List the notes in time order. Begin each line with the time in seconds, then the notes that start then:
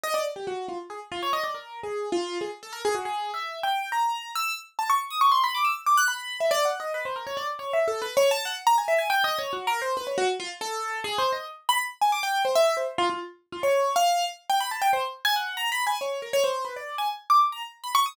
0.04 D#5
0.14 D5
0.36 G4
0.47 F#4
0.68 F4
0.90 G#4
1.12 F4
1.23 C#5
1.33 D#5
1.44 D5
1.54 A#4
1.83 G#4
2.12 F4
2.41 G#4
2.63 A4
2.73 A#4
2.85 G#4
2.95 F#4
3.05 G#4
3.34 E5
3.63 G5
3.92 A#5
4.35 E6
4.79 A5
4.90 C#6
5.10 D#6
5.21 C#6
5.32 C6
5.44 B5
5.55 D6
5.64 E6
5.86 D6
5.97 F#6
6.08 B5
6.40 E5
6.51 D5
6.65 F#5
6.80 D#5
6.94 B4
7.05 C5
7.16 A#4
7.27 C#5
7.37 D5
7.59 C#5
7.73 E5
7.88 A4
8.02 B4
8.17 C#5
8.31 A5
8.45 F#5
8.67 A#5
8.78 G#5
8.88 E5
8.98 G#5
9.10 G5
9.24 D#5
9.39 C#5
9.53 F#4
9.67 A#4
9.82 C5
9.97 B4
10.07 C#5
10.18 F#4
10.40 F4
10.61 A4
11.04 G#4
11.18 C5
11.32 D#5
11.69 B5
12.01 G#5
12.12 D6
12.23 G5
12.45 C5
12.55 E5
12.77 C5
12.98 F4
13.10 F4
13.52 F4
13.63 C#5
13.96 F5
14.50 G5
14.60 B5
14.71 A5
14.82 G5
14.93 C5
15.25 G#5
15.36 F#5
15.57 A#5
15.72 B5
15.87 G#5
16.01 C#5
16.22 A#4
16.33 C#5
16.44 C5
16.65 B4
16.76 D5
16.98 G#5
17.30 D6
17.52 A#5
17.84 B5
17.95 C#6
18.06 D#6